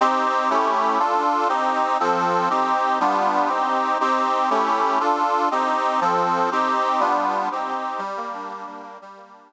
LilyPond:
\new Staff { \time 6/8 \key c \dorian \tempo 4. = 120 <c' ees' g'>4. <a cis' e' g'>4. | <d' f' a'>4. <c' ees' g'>4. | <f c' a'>4. <c' ees' g'>4. | <g b d' f'>4. <c' ees' g'>4. |
<c' ees' g'>4. <a cis' e' g'>4. | <d' f' a'>4. <c' ees' g'>4. | <f c' a'>4. <c' ees' g'>4. | <g b d' f'>4. <c' ees' g'>4. |
\key g \dorian g8 bes8 d'8 bes8 g8 bes8 | g8 bes8 d'8 bes8 r4 | }